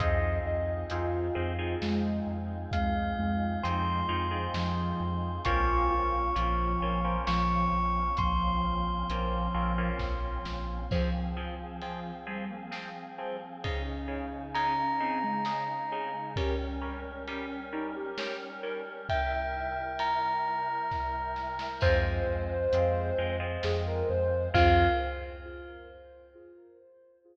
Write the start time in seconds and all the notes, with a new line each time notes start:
0.00 F2 C4 D#4 F4 G#4 D#5, kick, closed hi-hat
0.45 F2 D#5
0.90 F2 C4 D#4 F4 G#4, closed hi-hat
1.35 F2 C4 D#4 F4 G#4
1.59 C4 D#4 F4 G#4
1.81 F2 G#3, snare
2.27 F2
2.71 F2 G#3 F5, kick, closed hi-hat
3.18 F2 G#3
3.63 F2 F3 C4 D#4 F4 G#4 C6, closed hi-hat
4.09 F2 C4 D#4 F4 G#4
4.31 C4 D#4 F4 G#4
4.54 F2 F3, snare
5.00 F2
5.45 A#1 A#3 C4 C#4 F4 C#6, kick, closed hi-hat
5.91 A#1 F4
6.35 A#1 F3 A#3 C4 C#4 F4, closed hi-hat
6.82 A#1 A#3 C4 C#4 F4
7.04 A#3 C4 C#4 F4
7.27 A#1 F3 C#6, snare
7.72 A#1
8.17 A#1 F3 C6, kick, closed hi-hat
8.64 A#1
9.10 A#1 A#3 C4 C#4 F4, closed hi-hat
9.54 A#1 A#3 C4 C#4 F4
9.78 A#3 C4 C#4 F4
9.99 A#1, kick, snare
10.45 A#1, snare
10.91 F3 C4 G#4, kick, crash
11.37 F3 C4 G#4
11.82 F3 C4 G#4, ride
12.27 F3 G3 C4 G#4
12.50 A#3
12.71 F3 C4 G#4, snare
13.18 F3 C4 G#4
13.64 C#3 C#4 D#4 G#4, kick, ride
14.08 C#3 D#4 G#4
14.55 C#3 D#4 G#4 A#5, ride
15.00 C#3 C4 D#4 G#4
15.23 G#3
15.45 C#3 D#4 G#4, snare
15.92 C#3 D#4 G#4
16.36 G3 C#4 A#4, kick, ride
16.81 G3 C#4 A#4
17.28 G3 C#4 A#4, ride
17.72 G3 C#4 D#4 A#4
17.96 G4
18.18 G3 C#4 A#4, snare
18.63 G3 C#4 A#4
19.09 C3 G3 E4 A#4 E5 G5, kick, ride
19.99 A#5, ride
20.91 kick, snare
21.36 snare
21.59 snare
21.81 F2 G#3 C4 F4 C5, kick, crash
22.27 F2
22.73 F2 G#3 C4 F4, closed hi-hat
23.18 F2 G#3 C4 F4
23.40 G#3 C4 F4
23.63 F2 G#4, snare
23.87 A#4
24.09 F2 C5
24.54 F2 C4 F4 G#4 F5, kick, crash